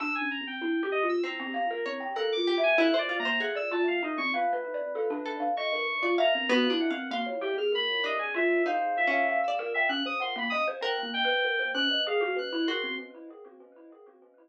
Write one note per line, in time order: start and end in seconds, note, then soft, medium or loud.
0.00 0.19 D4 loud
0.00 0.13 E6 loud
0.15 0.29 G#5 medium
0.22 0.40 C#4 medium
0.31 0.45 A#5 medium
0.41 0.60 C4 soft
0.47 0.89 G5 medium
0.61 0.80 E4 medium
0.83 1.02 G4 loud
0.92 1.06 D#5 loud
1.03 1.22 F4 medium
1.09 1.23 E6 loud
1.24 1.79 C4 medium
1.24 2.08 A#5 medium
1.40 1.53 C4 loud
1.54 1.68 F5 medium
1.70 1.84 A#4 medium
1.86 2.00 C4 medium
1.86 2.14 C#5 medium
2.00 2.14 G5 medium
2.15 2.35 A4 medium
2.15 2.44 A#4 medium
2.15 2.29 F#6 medium
2.32 2.60 D6 loud
2.37 2.56 F4 medium
2.47 2.75 G4 medium
2.58 2.76 E5 medium
2.63 2.77 G#5 loud
2.78 2.92 E4 loud
2.78 2.97 E5 medium
2.78 2.97 F#6 medium
2.94 3.08 C5 medium
2.98 3.17 D5 loud
2.98 3.19 D5 medium
3.09 3.23 F4 medium
3.19 3.38 A#3 medium
3.19 3.38 A#5 loud
3.25 3.39 C5 medium
3.40 3.68 G#4 medium
3.40 3.55 F#5 medium
3.55 3.69 D5 medium
3.55 3.70 E6 medium
3.71 3.85 F4 medium
3.71 3.86 A5 medium
3.86 4.00 F4 medium
3.86 4.02 F5 medium
4.03 4.16 D#4 loud
4.03 4.18 D#5 medium
4.18 4.32 C4 medium
4.18 4.31 C#6 medium
4.34 5.46 B4 medium
4.34 4.52 F5 medium
4.53 4.71 B4 medium
4.74 4.93 D5 medium
4.95 5.09 A4 medium
5.10 5.38 D4 loud
5.26 5.53 A4 medium
5.40 5.54 F5 medium
5.57 5.71 D#5 loud
5.57 6.12 C#6 medium
5.73 5.87 A#4 medium
6.03 6.16 F4 medium
6.03 6.17 D5 medium
6.18 6.32 E5 medium
6.18 6.46 F5 medium
6.18 6.48 A#5 medium
6.35 6.49 C4 medium
6.49 6.68 B3 loud
6.49 6.69 F#4 medium
6.49 6.78 F#6 medium
6.70 6.89 D4 medium
6.70 6.89 E4 loud
6.80 7.08 F#5 medium
6.90 7.09 C4 medium
6.90 7.09 F5 medium
7.11 7.25 A#3 loud
7.11 7.67 F5 medium
7.11 7.26 C6 medium
7.26 7.40 C#5 medium
7.41 7.55 G4 loud
7.41 7.55 G5 medium
7.57 7.71 G#4 medium
7.57 7.72 F6 medium
7.72 8.14 A#4 medium
7.72 8.03 B5 loud
8.04 8.60 D4 medium
8.04 8.19 D#5 loud
8.19 8.33 G#5 medium
8.34 8.62 F4 loud
8.34 8.63 E5 medium
8.66 9.03 D#4 medium
8.66 8.94 C5 medium
8.66 9.08 F5 medium
8.97 9.39 E5 loud
9.07 9.44 C#4 medium
9.12 9.26 F5 medium
9.29 9.57 F5 medium
9.43 9.71 E6 soft
9.48 9.85 D5 medium
9.59 9.73 A#4 medium
9.74 9.88 E5 loud
9.74 9.89 G5 medium
9.89 10.03 C#4 loud
9.89 10.03 F#6 medium
10.06 10.19 C5 medium
10.06 10.20 D#6 medium
10.20 10.34 F#5 medium
10.20 10.35 C6 medium
10.36 10.50 A#3 loud
10.36 10.52 B5 medium
10.50 10.66 D#5 medium
10.50 10.64 D#6 loud
10.68 10.81 C5 loud
10.81 11.10 A#4 medium
10.81 11.00 G5 medium
10.81 11.11 F#6 medium
11.03 11.21 A#3 medium
11.14 11.69 G5 loud
11.25 11.43 B4 medium
11.45 11.59 A#4 medium
11.59 11.73 C5 medium
11.74 11.88 C#4 loud
11.74 12.02 F#6 loud
11.91 12.05 D#5 medium
12.07 12.21 G#4 loud
12.07 12.35 F5 medium
12.21 12.35 F#4 loud
12.36 12.50 B4 medium
12.36 12.66 F#6 medium
12.53 12.66 E4 loud
12.67 12.96 F#4 medium
12.67 12.82 A#4 medium
12.67 12.95 C6 medium
12.84 12.97 C4 medium